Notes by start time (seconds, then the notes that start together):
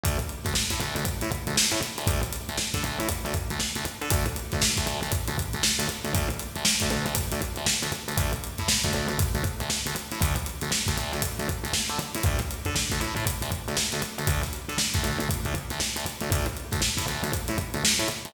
0.03 D2, kick, closed hi-hat
0.19 closed hi-hat
0.29 closed hi-hat
0.44 D2, kick, snare, closed hi-hat
0.55 snare
0.69 A2, kick, snare, closed hi-hat
0.80 D2, snare, closed hi-hat
0.96 D2, closed hi-hat
1.05 kick, closed hi-hat
1.21 A2, closed hi-hat
1.32 kick, closed hi-hat
1.47 D2, closed hi-hat
1.57 snare
1.71 A2, snare, closed hi-hat
1.83 closed hi-hat
1.98 D2, closed hi-hat
2.07 D2, kick, closed hi-hat
2.23 closed hi-hat
2.33 snare, closed hi-hat
2.49 D2, closed hi-hat
2.58 snare
2.74 D3, kick, snare, closed hi-hat
2.84 D2, closed hi-hat
3.00 A2, closed hi-hat
3.09 kick, closed hi-hat
3.25 D2, closed hi-hat
3.34 kick, closed hi-hat
3.50 D2, closed hi-hat
3.60 snare
3.75 D2, closed hi-hat
3.85 closed hi-hat
4.01 D3, closed hi-hat
4.10 D2, kick, closed hi-hat
4.26 closed hi-hat
4.36 closed hi-hat
4.52 D2, kick, snare, closed hi-hat
4.62 snare
4.77 D2, kick, snare, closed hi-hat
4.86 D2, snare, closed hi-hat
5.02 D2, closed hi-hat
5.12 kick, closed hi-hat
5.28 D2, closed hi-hat
5.38 kick, closed hi-hat
5.53 D2, closed hi-hat
5.63 snare
5.79 D2, closed hi-hat
5.89 closed hi-hat
6.04 D2, closed hi-hat
6.15 D2, kick, closed hi-hat
6.30 closed hi-hat
6.39 closed hi-hat
6.56 D2, closed hi-hat
6.65 snare
6.80 D2, kick, snare, closed hi-hat
6.90 D2, closed hi-hat
7.06 D2, closed hi-hat
7.15 kick, closed hi-hat
7.32 D2, closed hi-hat
7.41 kick, closed hi-hat
7.56 D2, closed hi-hat
7.66 snare
7.83 D2, closed hi-hat
7.92 closed hi-hat
8.08 D2, closed hi-hat
8.17 D2, kick, closed hi-hat
8.33 closed hi-hat
8.44 closed hi-hat
8.58 A2, kick, snare, closed hi-hat
8.68 snare
8.83 D2, kick, snare, closed hi-hat
8.93 D2, snare, closed hi-hat
9.08 D2, snare, closed hi-hat
9.19 kick, closed hi-hat
9.35 D2, closed hi-hat
9.44 kick, closed hi-hat
9.60 D2, closed hi-hat
9.70 snare
9.86 D2, closed hi-hat
9.96 closed hi-hat
10.12 A2, closed hi-hat
10.21 D2, kick, closed hi-hat
10.36 closed hi-hat
10.46 closed hi-hat
10.61 D2, closed hi-hat
10.72 snare
10.86 D2, kick, snare, closed hi-hat
10.98 D2, closed hi-hat
11.12 D2, snare, closed hi-hat
11.22 kick, closed hi-hat
11.39 D2, closed hi-hat
11.49 kick, closed hi-hat
11.64 D2, closed hi-hat
11.73 snare
11.89 D3, snare, closed hi-hat
11.99 snare, closed hi-hat
12.15 A2, closed hi-hat
12.23 D2, kick, closed hi-hat
12.39 snare, closed hi-hat
12.51 closed hi-hat
12.65 D3, kick, closed hi-hat
12.76 snare
12.90 D2, kick, snare, closed hi-hat
13.00 A2, closed hi-hat
13.16 A2, closed hi-hat
13.27 kick, closed hi-hat
13.42 D2, closed hi-hat
13.51 kick, closed hi-hat
13.68 D2, closed hi-hat
13.77 snare
13.92 D2, closed hi-hat
14.02 closed hi-hat
14.18 D2, closed hi-hat
14.27 D2, kick, closed hi-hat
14.43 snare, closed hi-hat
14.53 closed hi-hat
14.69 D3, snare, closed hi-hat
14.78 snare
14.94 D2, kick, snare, closed hi-hat
15.04 D2, snare, closed hi-hat
15.20 D2, closed hi-hat
15.29 kick, closed hi-hat
15.45 D2, closed hi-hat
15.54 kick, closed hi-hat
15.70 D2, snare, closed hi-hat
15.80 snare
15.96 D2, closed hi-hat
16.06 closed hi-hat
16.21 D2, closed hi-hat
16.32 D2, kick, closed hi-hat
16.46 closed hi-hat
16.57 closed hi-hat
16.71 D2, kick, snare, closed hi-hat
16.82 snare
16.97 A2, kick, snare, closed hi-hat
17.07 D2, snare, closed hi-hat
17.23 D2, closed hi-hat
17.33 kick, closed hi-hat
17.48 A2, closed hi-hat
17.58 kick, closed hi-hat
17.74 D2, closed hi-hat
17.85 snare
17.98 A2, snare, closed hi-hat
18.08 closed hi-hat
18.25 D2, closed hi-hat